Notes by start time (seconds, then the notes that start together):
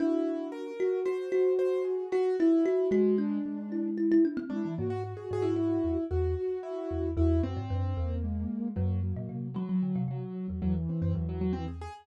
0.00 D4 E4 F#4
0.52 A#4
0.80 F#4
1.05 F#4 C5
1.32 F#4
1.59 C5
1.85 G#4
2.12 F#4
2.39 E4 F#4
2.66 F#4
2.91 G#3 F#4
3.18 D4
3.46 G#3
3.72 E4
3.98 E4
4.12 E4
4.25 D4
4.37 C4
4.50 G#3 D4 E4
4.65 E3
4.78 G#2 A#3 F#4
4.90 F#4
5.04 F#4
5.17 G#4
5.31 G#2 G#4
5.42 E4
5.56 E4
5.84 E2
6.11 E2 F#4
6.37 F#4
6.63 E4
6.91 E2
7.17 E2 E4 F#4
7.43 F#2 C4
7.57 G#2
7.70 F#2 D4
7.96 E2 A#3
8.24 G#3
8.76 F#2 F#3 A#3
9.03 F#3
9.16 A#2
9.29 C3
9.54 F#3
9.69 F#3
9.83 D3
9.96 C3
10.08 C3 F#3
10.48 E2 F#3
10.62 E2 E3 F#3
10.75 E2
10.89 C4
11.02 F#2 C4
11.14 E2 F#3
11.29 F#3
11.41 F#3
11.53 E3 C4
11.68 G#4
11.81 G#4